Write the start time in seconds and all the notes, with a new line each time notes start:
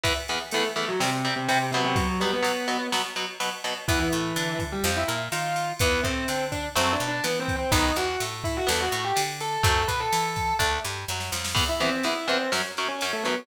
0.04 E2 E3 B3, kick, ride
0.28 E2 E3 B3, ride
0.51 E2 E3 A3 B3 A4, ride
0.76 E2 E3 A3 B3 A4, ride
0.88 F#3 F#4
1.00 C3 G3 C4, snare
1.25 C3 G3 C4, ride
1.36 C3 C4
1.48 C3 G3 C4, ride
1.72 B2 C3 F#3 B3 C4, ride
1.84 C3 C4
1.96 F#3 F#4, kick, ride
2.20 B2 F#3 G3 B3 G4, ride
2.32 B3 B4
2.43 B2 F#3 B3, ride
2.68 B2 F#3 B3, ride
2.92 B2 F#3 B3, snare
3.16 B2 F#3 B3, ride
3.40 B2 F#3 B3, ride
3.64 B2 F#3 B3, ride
3.88 E2 E3 B3 E4, kick, ride
3.99 E3 E4
4.12 A2 A3, ride
4.36 D3 D4, ride
4.59 kick, ride
4.72 G3 G4
4.84 F2 F3 C4, snare
4.97 E4 E5
5.08 A#2 A#3, ride
5.32 D#3 D#4 F4 F5, ride
5.56 ride
5.79 E2 E3 B3 B4, kick, ride
6.03 A2 A3 C4 C5, kick, ride
6.28 D3 C4 D4 C5, ride
6.52 D4 D5, kick, ride
6.75 F#2 F#3 A3 C4 C5, snare
6.93 D4 D5
7.00 B2 B3, ride
7.08 D4 D5
7.24 E3 B3 E4 B4, ride
7.40 C4 C5
7.48 kick, ride
7.56 C4 C5
7.71 B1 D#3 F#3 B3 D#4 D#5, kick, ride
7.96 E2 E3 F#4 F#5, ride
8.20 A2 A3, ride
8.44 E4 E5, kick, ride
8.57 F#4 F#5
8.67 E2 E3 B3 A4 A5, snare
8.80 F#4 F#5
8.91 A2 A3, ride
9.04 G4 G5
9.16 D3 D4, ride
9.40 A4 A5, ride
9.53 A4 A5
9.63 F#2 F#3 A3 C4 A4 A5, kick, ride
9.88 B2 B3 B4 B5, kick, ride
10.00 A4 A5
10.12 E3 E4, ride
10.36 kick, ride
10.59 D2 A3 D4, kick, snare
10.85 G2 G3, snare
11.08 F#2 F#3, snare
11.20 snare
11.32 F2 F3, snare
11.45 snare
11.55 E2 E3 B3, kick, crash
11.69 E4 E5
11.80 E2 E3 B3 C4 C5, ride
12.03 E2 E3 B3 E4 E5, ride
12.27 E2 E3 B3 C4 C5, ride
12.52 F#2 F#3 C#4, snare
12.77 F#2 F#3 C#4, ride
12.88 C#4 C#5
13.01 F#2 F#3 C#4, ride
13.13 A3 A4
13.23 F#2 F#3 B3 C#4 B4, ride